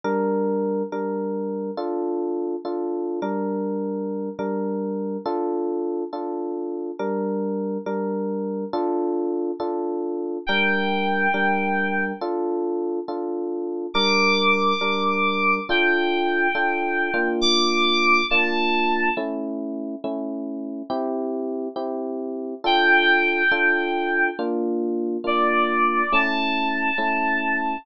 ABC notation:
X:1
M:6/8
L:1/8
Q:3/8=69
K:Dm
V:1 name="Electric Piano 2"
z6 | z6 | z6 | z6 |
z6 | z6 | g6 | z6 |
d'6 | g6 | d'3 a3 | z6 |
z6 | g6 | z3 d3 | a6 |]
V:2 name="Electric Piano 1"
[G,DB]3 [G,DB]3 | [DFA]3 [DFA]2 [G,DB]- | [G,DB]3 [G,DB]3 | [DFA]3 [DFA]3 |
[G,DB]3 [G,DB]3 | [DFA]3 [DFA]3 | [G,DB]3 [G,DB]3 | [DFA]3 [DFA]3 |
[G,DB]3 [G,DB]3 | [DFA]3 [DFA]2 [B,DF]- | [B,DF]3 [B,DF]3 | [A,^CE]3 [A,CE]3 |
[CEG]3 [CEG]3 | [DFA]3 [DFA]3 | [B,DF]3 [B,DF]3 | [A,^CE]3 [A,CE]3 |]